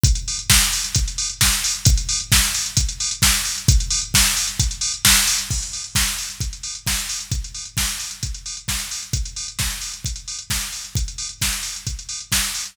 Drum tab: CC |----------------|----------------|----------------|x---------------|
HH |xxox-xoxxxox-xox|xxox-xoxxxox-xox|xxox-xoxxxox-xox|-xox-xoxxxox-xox|
SD |----o-------o---|----o-------o---|----o-------o---|----o-------o---|
BD |o---o---o---o---|o---o---o---o---|o---o---o---o---|o---o---o---o---|

CC |----------------|----------------|----------------|
HH |xxox-xoxxxox-xox|xxox-xoxxxox-xox|xxox-xoxxxox-xox|
SD |----o-------o---|----o-------o---|----o-------o---|
BD |o---o---o---o---|o---o---o---o---|o---o---o---o---|